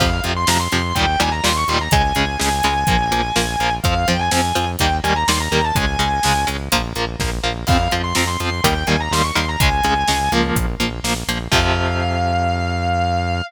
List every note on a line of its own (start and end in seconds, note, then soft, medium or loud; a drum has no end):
0.00 0.20 F2 medium
0.00 0.10 C3 medium
0.00 0.10 F3 medium
0.00 0.19 F5 loud
0.00 kick loud
0.00 crash loud
0.24 0.45 F2 medium
0.24 0.33 C3 medium
0.24 0.33 F3 medium
0.24 closed hi-hat medium
0.37 0.48 C6 loud
0.47 0.68 F2 medium
0.47 0.57 C3 medium
0.47 0.57 F3 medium
0.47 0.59 A#5 medium
0.47 snare loud
0.60 0.95 C6 medium
0.72 0.93 F2 medium
0.72 0.82 C3 medium
0.72 0.82 F3 medium
0.72 closed hi-hat medium
0.95 1.16 D#2 medium
0.95 1.06 A#2 medium
0.95 1.06 D#3 medium
0.95 1.06 G3 medium
0.95 1.17 G5 loud
0.95 kick medium
0.95 closed hi-hat medium
1.20 1.41 D#2 medium
1.20 1.29 A#2 medium
1.20 1.29 D#3 medium
1.20 1.29 G3 medium
1.20 1.31 G#5 loud
1.20 closed hi-hat medium
1.32 1.43 A#5 medium
1.44 1.64 D#2 medium
1.44 1.53 A#2 medium
1.44 1.53 D#3 medium
1.44 1.53 G3 medium
1.44 1.56 C6 loud
1.44 snare loud
1.56 1.68 C#6 loud
1.68 1.88 D#2 medium
1.68 1.79 A#2 medium
1.68 1.79 D#3 medium
1.68 1.79 G3 medium
1.68 1.80 C6 medium
1.68 closed hi-hat medium
1.81 1.92 A#5 medium
1.91 2.12 C#2 medium
1.91 2.02 C#3 medium
1.91 2.02 G#3 loud
1.91 3.71 G#5 loud
1.91 kick loud
1.91 closed hi-hat loud
2.15 2.37 C#2 medium
2.15 2.25 C#3 medium
2.15 2.25 G#3 medium
2.15 closed hi-hat medium
2.40 2.61 C#2 medium
2.40 2.49 C#3 medium
2.40 2.49 G#3 medium
2.40 snare loud
2.63 2.84 C#2 medium
2.63 2.74 C#3 medium
2.63 2.74 G#3 medium
2.63 closed hi-hat medium
2.87 3.09 A#1 medium
2.87 2.97 F3 medium
2.87 2.97 A#3 medium
2.87 kick loud
2.87 closed hi-hat loud
3.11 3.31 A#1 medium
3.11 3.21 F3 medium
3.11 3.21 A#3 medium
3.11 closed hi-hat medium
3.36 3.56 A#1 medium
3.36 3.46 F3 medium
3.36 3.46 A#3 medium
3.36 snare loud
3.59 3.80 A#1 medium
3.59 3.70 F3 medium
3.59 3.70 A#3 medium
3.59 closed hi-hat medium
3.84 4.05 F2 medium
3.84 3.94 F3 medium
3.84 3.94 C4 medium
3.84 4.05 F5 loud
3.84 kick loud
3.84 closed hi-hat medium
4.08 4.29 F2 medium
4.08 4.17 F3 medium
4.08 4.17 C4 medium
4.08 4.19 G5 loud
4.08 closed hi-hat medium
4.19 4.31 G#5 medium
4.31 4.53 F2 medium
4.31 4.41 F3 medium
4.31 4.41 C4 medium
4.31 4.65 G#5 medium
4.31 snare loud
4.55 4.76 F2 medium
4.55 4.65 F3 medium
4.55 4.65 C4 medium
4.55 closed hi-hat medium
4.79 5.00 D#2 medium
4.79 4.90 D#3 medium
4.79 4.90 G3 medium
4.79 4.90 A#3 medium
4.79 4.92 G5 loud
4.79 kick medium
4.79 closed hi-hat loud
5.04 5.24 D#2 medium
5.04 5.13 D#3 medium
5.04 5.13 G3 medium
5.04 5.13 A#3 medium
5.04 5.15 G#5 loud
5.04 closed hi-hat medium
5.16 5.27 A#5 loud
5.28 5.48 D#2 medium
5.28 5.38 D#3 medium
5.28 5.38 G3 medium
5.28 5.38 A#3 medium
5.28 5.39 C6 loud
5.28 snare loud
5.40 5.62 A#5 loud
5.51 5.72 D#2 medium
5.51 5.62 D#3 medium
5.51 5.62 G3 medium
5.51 5.62 A#3 medium
5.51 closed hi-hat medium
5.65 5.76 A5 loud
5.75 5.97 C#2 medium
5.75 5.85 C#3 medium
5.75 5.85 G#3 medium
5.75 6.42 G#5 loud
5.75 kick loud
5.75 closed hi-hat loud
5.99 6.19 C#2 medium
5.99 6.09 C#3 medium
5.99 6.09 G#3 medium
5.99 closed hi-hat medium
6.23 6.45 C#2 medium
6.23 6.33 C#3 medium
6.23 6.33 G#3 medium
6.23 snare loud
6.47 6.69 C#2 medium
6.47 6.57 C#3 medium
6.47 6.57 G#3 medium
6.47 closed hi-hat medium
6.72 6.93 A#1 medium
6.72 6.82 F3 medium
6.72 6.82 A#3 medium
6.72 kick medium
6.72 closed hi-hat loud
6.96 7.16 A#1 medium
6.96 7.05 F3 medium
6.96 7.05 A#3 medium
6.96 closed hi-hat medium
7.19 7.40 A#1 medium
7.19 7.30 F3 medium
7.19 7.30 A#3 medium
7.19 kick medium
7.19 snare medium
7.44 7.64 A#1 medium
7.44 7.53 F3 medium
7.44 7.53 A#3 medium
7.67 7.88 F2 medium
7.67 7.78 F3 medium
7.67 7.78 C4 medium
7.67 7.91 F5 loud
7.67 kick loud
7.67 crash loud
7.91 8.13 F2 medium
7.91 8.02 F3 medium
7.91 8.02 C4 medium
7.91 closed hi-hat medium
8.04 8.15 C6 loud
8.15 8.37 F2 medium
8.15 8.25 F3 medium
8.15 8.25 C4 medium
8.15 8.28 A#5 medium
8.15 snare loud
8.27 8.60 C6 loud
8.40 8.61 F2 medium
8.40 8.50 F3 medium
8.40 8.50 C4 medium
8.40 closed hi-hat medium
8.64 8.84 D#2 medium
8.64 8.74 D#3 medium
8.64 8.74 G3 medium
8.64 8.74 A#3 medium
8.64 8.84 G5 medium
8.64 kick medium
8.64 closed hi-hat loud
8.87 9.09 D#2 medium
8.87 8.97 D#3 medium
8.87 8.97 G3 medium
8.87 8.97 A#3 medium
8.87 8.99 G#5 medium
8.87 closed hi-hat medium
9.00 9.12 A#5 loud
9.11 9.31 D#2 medium
9.11 9.22 D#3 medium
9.11 9.22 G3 medium
9.11 9.22 A#3 medium
9.11 9.23 C6 loud
9.11 snare loud
9.24 9.35 C#6 medium
9.35 9.56 D#2 medium
9.35 9.45 D#3 medium
9.35 9.45 G3 medium
9.35 9.45 A#3 medium
9.35 9.47 C6 loud
9.35 closed hi-hat medium
9.49 9.60 A#5 loud
9.60 9.81 C#2 medium
9.60 9.70 C#3 medium
9.60 9.70 G#3 loud
9.60 10.26 G#5 loud
9.60 kick loud
9.60 closed hi-hat loud
9.84 10.04 C#2 medium
9.84 9.94 C#3 medium
9.84 9.94 G#3 medium
9.84 closed hi-hat medium
10.08 10.29 C#2 medium
10.08 10.18 C#3 medium
10.08 10.18 G#3 medium
10.08 snare loud
10.31 10.52 C#2 medium
10.31 10.66 F3 medium
10.31 10.66 A#3 loud
10.31 closed hi-hat medium
10.55 10.76 A#1 medium
10.55 kick loud
10.55 closed hi-hat loud
10.80 11.00 A#1 medium
10.80 10.89 F3 medium
10.80 10.89 A#3 medium
10.80 closed hi-hat medium
11.03 11.23 A#1 medium
11.03 11.14 F3 medium
11.03 11.14 A#3 medium
11.03 snare loud
11.27 11.48 A#1 medium
11.27 11.38 F3 medium
11.27 11.38 A#3 medium
11.27 closed hi-hat medium
11.52 13.41 F2 loud
11.52 13.41 C3 loud
11.52 13.41 F3 loud
11.52 13.42 F5 loud
11.52 kick loud
11.52 crash loud